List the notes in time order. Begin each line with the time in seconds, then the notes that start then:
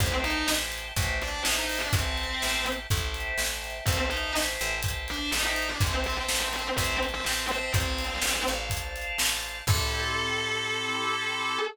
0.00 A1 C4 C5 E5 G5 A5, kick, closed hi-hat
0.24 D#4 D#5, closed hi-hat
0.48 A1, snare
0.72 closed hi-hat
0.96 A1 C5 E5 G5 A5, kick, closed hi-hat
1.22 D4 D5, closed hi-hat
1.45 A1 D#4 D#5, snare
1.56 D#4 D#5
1.69 open hi-hat
1.81 D4 D5
1.93 A1 C4 C5 E5 G5 A5, kick, closed hi-hat
2.17 closed hi-hat
2.42 A1, snare
2.66 closed hi-hat
2.90 A1 C5 E5 G5 A5, kick, closed hi-hat
3.14 closed hi-hat
3.38 A1, snare
3.64 closed hi-hat
3.86 A1 C4 C5 E5 G5 A5, kick, closed hi-hat
4.09 D#4 D#5, closed hi-hat
4.35 A1, snare
4.60 A1, closed hi-hat
4.83 C5 E5 G5 A5, kick, closed hi-hat
5.08 D4 D5, closed hi-hat
5.31 A1 D#4 D#5, snare
5.46 D#4 D#5
5.56 closed hi-hat
5.70 D4 D5
5.80 A1 C4 C5 E5 G5 A5, kick, closed hi-hat
6.04 C4 C5, closed hi-hat
6.17 C4 C5
6.29 A1, snare
6.41 C4 C5
6.53 C4 C5, closed hi-hat
6.76 A1 C4 C5 E5 G5 A5, kick, closed hi-hat
7.03 closed hi-hat
7.14 C4 C5
7.24 A1 C4 C5, snare
7.49 C4 C5, closed hi-hat
7.74 A1 C4 C5 D5 F5 A5, kick, closed hi-hat
7.98 closed hi-hat
8.22 A1, snare
8.47 A1 C5 D5 F5 A5, closed hi-hat
8.70 kick, closed hi-hat
8.96 closed hi-hat
9.18 A1, snare
9.43 closed hi-hat
9.67 A2 C4 E4 G4 A4, kick, crash